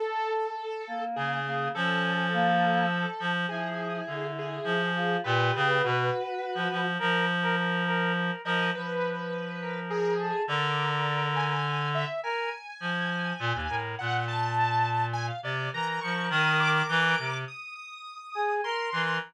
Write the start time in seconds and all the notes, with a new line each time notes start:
0.00 A4
0.87 A#3
1.16 C#3 G#4
1.46 A#3
1.75 F3 C#4 A4
2.33 A#3
3.20 F3
3.49 F3 E4 G#4
4.07 D3
4.38 G#4
4.64 F3
4.95 F4
5.24 A#2 G4 B4
5.55 C#3
5.82 B2 F#4
6.55 F3
6.71 F3
6.99 F3 A#4
7.43 A#4
7.57 A#4
7.87 A#4
8.15 A#4
8.45 F3 A#4 D#5
8.75 F3 B4
9.61 A#4
9.90 G#4
10.19 A4
10.48 D3 A#4 D5
11.36 G#5
11.95 E5
12.23 A#4 G#5
12.80 F3
13.39 A#2
13.54 D#2
13.69 A2 A#4
13.99 A#2 F#5
14.28 A5
15.13 G#5
15.27 F5
15.43 C3 D5
15.73 E3 A#4 A#5
16.01 F3 C#6
16.30 D#3 D#6
16.60 D6
16.89 E3
17.18 C3
17.48 D#6
17.75 D#6
18.35 G#4
18.64 A#4 C6
18.92 E3 A#4